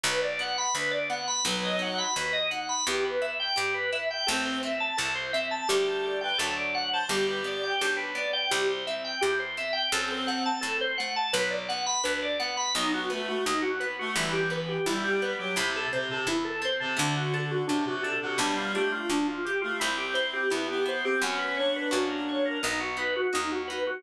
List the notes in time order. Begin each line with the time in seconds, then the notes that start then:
0.04 B1 F#3 B4
0.22 D5
0.39 B3 F#5
0.58 B5
0.75 D2 D4 B4
0.91 D5
1.10 B3 F#5
1.27 B5
1.45 B1 F#3 B3 B4
1.64 D#5
1.79 D#4 F#5
1.98 B5
2.16 D#2 F#4 B4
2.33 D#5
2.51 D#4 F#5
2.69 B5
2.87 E2 B3 G4
3.05 B4
3.21 E4 E5
3.40 G5
3.56 G2 G4
3.74 B4
3.92 E4 E5
4.10 G5
4.27 A1 A3 C4 A4
4.45 C5
4.63 C4 E5
4.80 A5
4.97 C2 E4 A4
5.15 C5
5.33 C4 E5
5.51 A5
5.68 D2 G3 A3 D4 G4
5.87 A4
6.03 D5
6.21 B4 G5
6.38 D2 F#3 A3 D4 A4
6.57 D5
6.74 F#5
6.92 C5 A5
7.09 G1 G3 G4
7.27 B4
7.44 B3 D5
7.63 G5
7.81 B1 D4 G4
7.97 B4
8.15 B3 D5
8.33 G5
8.51 C2 G3 G4
8.70 C5
8.87 C4 E5
9.04 G5
9.21 E2 E4 G4
9.39 C5
9.57 C4 E5
9.73 G5
9.92 F#2 F#3 C4 A4
10.11 C5
10.27 A3 F#5
10.46 A5
10.61 A2 C4 A4
10.81 C5
10.98 A3 F#5
11.16 A5
11.33 B1 F#3 B4
11.50 D5
11.69 B3 F#5
11.86 B5
12.04 D2 D4 B4
12.22 D5
12.39 B3 F#5
12.57 B5
12.75 B1 F#3 B3 D#4
12.94 F#4
13.10 A3 B3 B4
13.27 A3 F#4
13.46 D#2 D#4
13.62 F#4
13.80 B3 B4
13.99 A3 F#4
14.15 G1 E3 G3 E4
14.33 G4
14.50 B3 B4
14.68 G4
14.86 B1 G3 E4
15.02 G3 G4
15.22 B3 B4
15.38 F#3 G4
15.56 C2 C3 A3 E4
15.76 A4
15.93 C3 C4 C5
16.09 C3 A4
16.27 E2 E4
16.45 A4
16.62 C4 C5
16.80 C3 A4
16.97 D2 D3 A3 D4
17.17 F#4
17.34 D4 A4
17.51 F#4
17.67 F#2 C3 D4 F#4
17.85 C3 F#4
18.03 D4 A4
18.21 C3 F#4
18.38 B1 G3 B3 D4
18.57 F4
18.74 A3 D4 G4
18.92 A3 F4
19.10 D2 D4 F4
19.27 F4
19.45 G4
19.61 A3 F4
19.80 C2 C4 E4
19.98 G4
20.14 E4 C5
20.33 G4
20.50 E2 B3 E4 G4
20.68 B3 G4
20.86 E4 C5
21.03 C4 G4
21.22 F#2 B3 C#4 F#4
21.38 B4
21.57 D4 C#5
21.76 B4
21.91 F#2 A#3 C#4 F#4
22.10 A#4
22.29 C#5
22.45 A#4
22.63 B1 B3 D#4
22.80 F#4
22.97 D#4 B4
23.16 F#4
23.33 D#2 D#4 F#4
23.52 F#4
23.68 D#4 B4
23.87 F#4